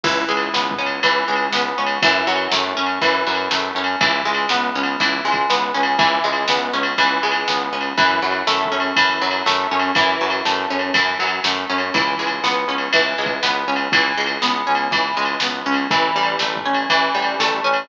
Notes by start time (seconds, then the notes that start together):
0.04 C#2 E3, kick, crash
0.29 C#2 G#3
0.37 ride
0.53 C#2 B3, snare
0.71 kick
0.79 C#2 C#4
0.86 ride
1.03 C#2 E3, kick, ride
1.28 C#2 G#3
1.36 ride
1.53 C#2 B3, snare
1.78 C#2 C#4
1.86 ride
2.02 F#2 E3, kick, ride
2.27 F#2 F#3
2.36 ride
2.52 F#2 A3, snare
2.77 F#2 C#4
2.86 ride
3.01 F#2 E3, kick, ride
3.27 F#2 F#3
3.35 ride
3.51 F#2 A3, snare
3.75 F#2 C#4
3.84 ride
4.01 C#2 E3, kick, ride
4.25 C#2 G#3
4.34 ride
4.49 C#2 B3, snare
4.75 C#2 C#4
4.83 ride
5.00 C#2 E3, kick, ride
5.25 C#2 G#3
5.32 kick, ride
5.50 C#2 B3, snare
5.74 C#2 C#4
5.83 ride
5.98 C#2 E3, kick, ride
6.24 C#2 G#3
6.33 ride
6.48 C#2 B3, snare
6.73 C#2 C#4
6.83 ride
6.98 C#2 E3, kick, ride
7.23 C#2 G#3
7.31 ride
7.48 C#2 B3, snare
7.73 C#2 C#4
7.81 ride
7.98 F#2 E3, kick, ride
8.22 F#2 F#3
8.31 ride
8.47 F#2 A3, snare
8.65 kick
8.72 F#2 C#4
8.80 ride
8.96 F#2 E3, kick, ride
9.21 F#2 F#3
9.31 ride
9.46 F#2 A3, snare
9.71 F#2 C#4
9.80 ride
9.95 F#2 E3, kick, ride
10.21 F#2 F#3
10.30 ride
10.45 F#2 A3, snare
10.70 F#2 C#4
10.79 ride
10.94 F#2 E3, kick, ride
11.19 F#2 F#3
11.27 ride
11.44 F#2 A3, snare
11.70 F#2 C#4
11.78 ride
11.94 C#2 E3, kick, ride
12.19 C#2 G#3
12.27 ride
12.44 C#2 B3, snare
12.68 C#2 C#4
12.78 ride
12.93 C#2 E3, kick, ride
13.18 C#2 G#3
13.26 kick, ride
13.43 C#2 B3, snare
13.67 C#2 C#4
13.76 ride
13.92 C#2 E3, kick, ride
14.17 C#2 G#3
14.26 ride
14.42 C#2 B3, snare
14.67 C#2 C#4
14.75 ride
14.91 C#2 E3, kick, ride
15.16 C#2 G#3
15.25 ride
15.40 C#2 B3, snare
15.66 C#2 C#4
15.74 ride
15.90 A1 E3, kick, ride
16.15 A1 G3
16.23 ride
16.39 A1 A3, snare
16.56 kick
16.65 A1 C#4
16.74 ride
16.90 A1 E3, kick, ride
17.15 A1 G3
17.22 ride
17.40 A1 A3, snare
17.64 A1 C#4
17.74 ride